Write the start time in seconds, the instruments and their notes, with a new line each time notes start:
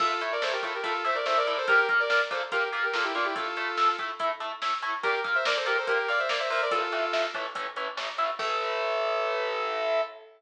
0.00 overdriven guitar A3 E4 A4, lead 2 (sawtooth) F4 A4, kick, crash
0.21 overdriven guitar A3 E4 A4, closed hi-hat
0.32 lead 2 (sawtooth) A#4 D5
0.42 overdriven guitar A3 E4 A4, lead 2 (sawtooth) A4 C5, snare
0.52 lead 2 (sawtooth) G4 A#4
0.63 overdriven guitar A3 E4 A4, lead 2 (sawtooth) F4 A4, kick, closed hi-hat
0.74 lead 2 (sawtooth) G4 A#4
0.84 overdriven guitar A3 E4 A4, lead 2 (sawtooth) F4 A4, kick, closed hi-hat
1.04 overdriven guitar A3 E4 A4, lead 2 (sawtooth) C5 E5, closed hi-hat
1.15 lead 2 (sawtooth) A#4 D5
1.25 overdriven guitar A3 E4 A4, lead 2 (sawtooth) A4 C5, snare
1.37 lead 2 (sawtooth) A#4 D5
1.46 overdriven guitar A3 E4 A4, lead 2 (sawtooth) A#4 D5, closed hi-hat
1.57 lead 2 (sawtooth) A4 C5
1.68 overdriven guitar A#3 F4 A#4, lead 2 (sawtooth) G4 A#4, kick, closed hi-hat
1.89 overdriven guitar A#3 F4 A#4, kick, closed hi-hat
2.00 lead 2 (sawtooth) A#4 D5
2.10 overdriven guitar A#3 F4 A#4, lead 2 (sawtooth) A#4 D5, snare
2.31 overdriven guitar A#3 F4 A#4, lead 2 (sawtooth) A4 C5, kick, closed hi-hat
2.52 overdriven guitar A#3 F4 A#4, lead 2 (sawtooth) G4 A#4, kick, closed hi-hat
2.73 overdriven guitar A#3 F4 A#4, closed hi-hat
2.83 lead 2 (sawtooth) G4 A#4
2.93 overdriven guitar A#3 F4 A#4, lead 2 (sawtooth) F4 A4, snare
3.04 lead 2 (sawtooth) E4 G4
3.15 overdriven guitar A#3 F4 A#4, lead 2 (sawtooth) D4 F4, closed hi-hat
3.25 lead 2 (sawtooth) E4 G4
3.36 overdriven guitar A3 E4 A4, lead 2 (sawtooth) F4 A4, kick, closed hi-hat
3.57 overdriven guitar A3 E4 A4, closed hi-hat
3.77 overdriven guitar A3 E4 A4, snare
3.99 overdriven guitar A3 E4 A4, kick, closed hi-hat
4.19 overdriven guitar A3 E4 A4, kick, closed hi-hat
4.40 overdriven guitar A3 E4 A4, closed hi-hat
4.62 overdriven guitar A3 E4 A4, snare
4.82 overdriven guitar A3 E4 A4, closed hi-hat
5.03 overdriven guitar A#3 F4 A#4, lead 2 (sawtooth) G4 A#4, kick, closed hi-hat
5.24 overdriven guitar A#3 F4 A#4, kick, closed hi-hat
5.35 lead 2 (sawtooth) C5 E5
5.45 overdriven guitar A#3 F4 A#4, lead 2 (sawtooth) A#4 D5, snare
5.56 lead 2 (sawtooth) A4 C5
5.66 overdriven guitar A#3 F4 A#4, lead 2 (sawtooth) G4 A#4, closed hi-hat
5.77 lead 2 (sawtooth) A4 C5
5.87 overdriven guitar A#3 F4 A#4, lead 2 (sawtooth) G4 A#4, kick, closed hi-hat
6.08 overdriven guitar A#3 F4 A#4, lead 2 (sawtooth) D5 F5, closed hi-hat
6.19 lead 2 (sawtooth) C5 E5
6.29 overdriven guitar A#3 F4 A#4, lead 2 (sawtooth) A#4 D5, snare
6.39 lead 2 (sawtooth) C5 E5
6.50 overdriven guitar A#3 F4 A#4, lead 2 (sawtooth) C5 E5, open hi-hat
6.62 lead 2 (sawtooth) A#4 D5
6.71 overdriven guitar A2 E3 A3, lead 2 (sawtooth) F4 A4, kick, closed hi-hat
6.92 overdriven guitar A2 E3 A3, closed hi-hat
7.13 overdriven guitar A2 E3 A3, snare
7.34 overdriven guitar A2 E3 A3, kick, closed hi-hat
7.55 overdriven guitar A2 E3 A3, kick, closed hi-hat
7.76 overdriven guitar A2 E3 A3, closed hi-hat
7.97 overdriven guitar A2 E3 A3, snare
8.18 overdriven guitar A2 E3 A3, closed hi-hat
8.39 overdriven guitar A2 E3 A3, lead 2 (sawtooth) A4, kick, crash